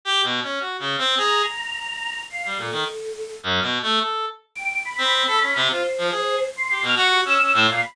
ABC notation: X:1
M:2/4
L:1/16
Q:1/4=106
K:none
V:1 name="Clarinet"
(3G2 B,,2 _D2 (3_G2 _D,2 C2 | _A2 z6 | z G, _B,, _E, z4 | (3_G,,2 B,,2 A,2 A2 z2 |
z3 C2 A _D C, | F z F, _A2 z2 G | B,, _G2 _D D A,, _B,, z |]
V:2 name="Choir Aahs"
z8 | _b8 | f2 A6 | z8 |
g2 b6 | c6 c'2 | f' _d' G e'3 f b |]